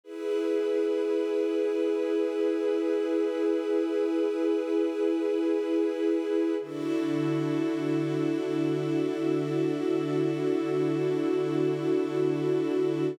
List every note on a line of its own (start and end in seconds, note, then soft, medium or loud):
0.04 6.55 E4 medium
0.04 6.55 G#4 medium
0.04 6.55 B4 medium
6.60 13.11 D3 medium
6.60 13.12 D4 medium
6.60 13.11 E4 medium
6.60 13.12 E4 medium
6.60 13.11 F#4 medium
6.60 13.12 F#4 medium
6.60 13.11 A4 medium
6.60 13.12 A4 medium